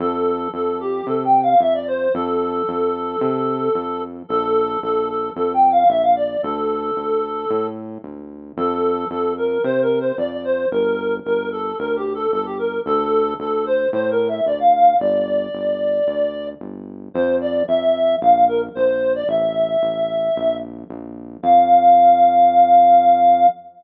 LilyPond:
<<
  \new Staff \with { instrumentName = "Clarinet" } { \time 4/4 \key f \major \tempo 4 = 112 a'4 a'8 g'8 \tuplet 3/2 { a'8 g''8 f''8 } e''16 d''16 c''8 | a'1 | a'4 a'8 a'8 \tuplet 3/2 { a'8 g''8 f''8 } e''16 f''16 d''8 | a'2~ a'8 r4. |
a'4 a'8 bes'8 \tuplet 3/2 { c''8 bes'8 c''8 } d''16 d''16 c''8 | bes'4 bes'8 a'8 \tuplet 3/2 { bes'8 g'8 a'8 } a'16 g'16 bes'8 | a'4 a'8 c''8 \tuplet 3/2 { c''8 bes'8 e''8 } d''16 f''16 f''8 | d''2. r4 |
c''8 d''8 e''4 f''8 bes'16 r16 c''8. d''16 | e''2~ e''8 r4. | f''1 | }
  \new Staff \with { instrumentName = "Synth Bass 1" } { \clef bass \time 4/4 \key f \major f,4 f,4 c4 f,4 | f,4 f,4 c4 f,4 | bes,,4 bes,,4 f,4 bes,,4 | d,4 d,4 a,4 d,4 |
f,4 f,4 c4 f,4 | g,,4 g,,4 d,4 g,,4 | d,4 d,4 a,4 d,4 | g,,4 g,,4 d,4 g,,4 |
f,4 f,4 bes,,4 bes,,4 | a,,4 a,,4 bes,,4 bes,,4 | f,1 | }
>>